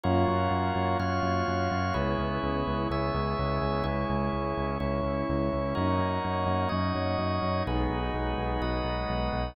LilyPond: <<
  \new Staff \with { instrumentName = "Pad 2 (warm)" } { \time 4/4 \key cis \dorian \tempo 4 = 126 <ais cis' eis' fis'>1 | <gis b cis' e'>1 | <gis cis' e'>1 | <fis ais cis' dis'>1 |
<fis gis b dis'>1 | }
  \new Staff \with { instrumentName = "Drawbar Organ" } { \time 4/4 \key cis \dorian <eis' fis' ais' cis''>2 <eis' fis' cis'' eis''>2 | <e' gis' b' cis''>2 <e' gis' cis'' e''>2 | <e' gis' cis''>2 <cis' e' cis''>2 | <dis' fis' ais' cis''>2 <dis' fis' cis'' dis''>2 |
<dis' fis' gis' b'>2 <dis' fis' b' dis''>2 | }
  \new Staff \with { instrumentName = "Synth Bass 1" } { \clef bass \time 4/4 \key cis \dorian fis,8 fis,8 fis,8 fis,8 fis,8 fis,8 fis,8 fis,8 | cis,8 cis,8 cis,8 cis,8 cis,8 cis,8 cis,8 cis,8 | cis,8 cis,8 cis,8 cis,8 cis,8 cis,8 cis,8 cis,8 | fis,8 fis,8 fis,8 fis,8 fis,8 fis,8 fis,8 fis,8 |
b,,8 b,,8 b,,8 b,,8 b,,8 b,,8 b,,8 b,,8 | }
>>